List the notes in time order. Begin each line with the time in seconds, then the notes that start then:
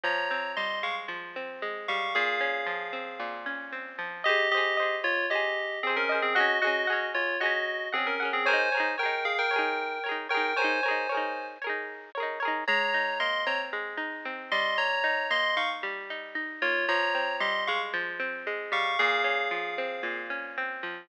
0.04 F3 C#5 A#5
0.31 C4
0.56 G3 D#5 C6
0.83 G#3 F5 C#6
1.08 F3
1.36 C4
1.62 G#3
1.88 G3 F5 C#6
2.15 A#2 G#4 F5
2.40 C#4
2.66 F3
2.93 C4
3.20 A#2
3.46 C#4
3.72 C4
3.99 F3
4.24 G4 C5 D#5
4.29 G#4
4.51 G4 C5 D#5
4.57 G#4
4.77 C5 D#5
4.82 G#4
5.04 F4 C#5
5.30 G4 C5 D#5
5.35 G#4
5.83 C4 G#4 C5 D#5
5.90 G#4
5.96 C#4 A#4
6.09 C5 D#5
6.14 G#4
6.22 C4 G#4
6.35 F#4 G#4 D#5 F#5
6.40 C#4
6.62 F#4 G#4 D#5 F#5
6.67 C#4
6.87 G#4 F#5
6.92 C#4
7.14 F4 C#5
7.40 F#4 G#4 D#5 F#5
7.46 C#4
7.92 C4 G#4 F#5
7.98 C#4
8.07 C#4 A#4
8.20 G#4 F#5
8.25 C#4
8.33 C4 G#4
8.46 A#4 C5 C#5 G#5
8.51 D#4 G#4
8.72 A#4 C#5
8.77 D#4 G#4
8.98 A#4 C#5 G5
9.03 D#4 G#4
9.25 G#4 F5
9.38 A#4 G5
9.51 A#4 C#5
9.56 D#4 G#4
10.04 A#4 C#5
10.09 D#4 G#4
10.29 A#4 C#5 G5
10.34 D#4 G#4
10.56 A#4 C5 C#5 G#5
10.62 D#4 G#4
10.83 A#4 C#5
10.88 D#4 G#4
11.09 A#4 C#5
11.14 D#4 G#4
11.62 A#4 C#5
11.67 D#4 G#4
12.15 A#4 C#5
12.20 D#4 G#4
12.40 A#4 C#5
12.45 D#4 G#4
12.68 G#3 C#5 A#5
12.94 D#4
13.20 A#3 D#5 C6
13.46 C4 C#5 A#5
13.73 G#3
13.97 D#4
14.25 C4
14.52 G3 D#5 C6
14.78 C#5 A#5
15.04 D#4
15.30 A#3 D#5 C6
15.57 D#4 F5 C#6
15.83 G3
16.10 D#4
16.35 D#4
16.62 A#3 F4 C#5
16.88 F3 C#5 A#5
17.15 C4
17.40 G3 D#5 C6
17.67 G#3 F5 C#6
17.93 F3
18.20 C4
18.47 G#3
18.72 G3 F5 C#6
18.99 A#2 G#4 F5
19.24 C#4
19.51 F3
19.78 C4
20.03 A#2
20.30 C#4
20.58 C4
20.83 F3